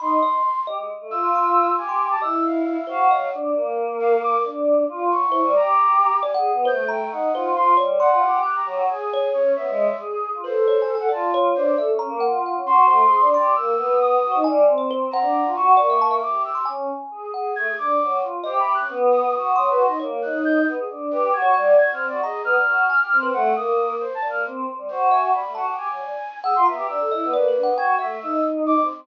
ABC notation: X:1
M:5/8
L:1/16
Q:1/4=135
K:none
V:1 name="Choir Aahs"
_E2 z4 G _A, z =A, | F6 G4 | E6 _G2 _G,2 | D2 _B,8 |
D4 F2 (3_G,2 E2 =G,2 | G6 (3G,2 _A2 B,2 | A,4 _E2 F4 | G,3 F G4 _G,2 |
_A4 _D2 B, _A,2 G, | _A3 F =A6 | F4 D2 (3A2 _D2 _B,2 | F3 _D _G2 (3A,2 _A2 =D2 |
G2 _B,2 =B,4 _G _E | G,2 C5 D2 F | _G2 _B,4 =G4 | _D2 z2 _A2 A2 =A, _A |
D2 _G,2 F2 =G3 _D | B,4 _G2 (3_G,2 G2 _E2 | _B,2 _E4 =B, _A D2 | G2 _G2 =G,2 _G C2 G |
_A2 B, G, _G2 z =G C2 | A,2 _B,4 z2 B,2 | C2 C G, _G4 =G, A, | _G =G G _G, =G, z3 _A F |
B, G D A E B, _B,2 D =B, | _G2 A,2 _E5 C |]
V:2 name="Kalimba"
b2 _e2 z2 e4 | z2 c'4 z c'2 z | _e6 c2 e2 | z10 |
d4 z4 c2 | z6 d _g3 | c2 _b4 c4 | _d2 c'4 g4 |
z2 _d8 | z4 B2 (3_d2 _a2 a2 | d2 _d4 e2 _b2 | _g2 g2 z2 c4 |
c'2 z7 c | _a3 d c2 _g4 | z2 d e a e4 c' | _a6 _g2 z2 |
z6 _e =e3 | z6 c'4 | _d6 z4 | z3 _d _g4 z2 |
_b6 _a z2 =B | z8 d2 | z6 e2 z2 | a2 z6 _g2 |
_b4 _e2 (3d2 =B2 _g2 | g2 e4 z4 |]
V:3 name="Flute"
c'6 z4 | e'6 _a3 =a | e'2 f4 f4 | z6 f2 d'2 |
z6 _d'4 | _b6 _a z3 | g'2 g2 _g4 c'2 | z2 _g4 _g' _b3 |
_a4 _d2 e4 | z4 c5 _g | a2 z2 c2 z4 | z4 c'6 |
d2 e'4 _e'4 | z6 _b4 | _d'6 =d'2 e'2 | z8 _a'2 |
d'4 z2 (3c2 b2 _g'2 | z2 _e'4 (3e'2 B2 _e2 | z2 _g'2 =g'2 z4 | B2 _a'4 (3a'2 f'2 d2 |
_e2 f'8 | _g2 _e'4 (3c2 a2 f'2 | z4 c2 _a2 b2 | _g2 _a6 e' c' |
e2 e'4 B4 | _a'2 e2 e'2 z2 d'2 |]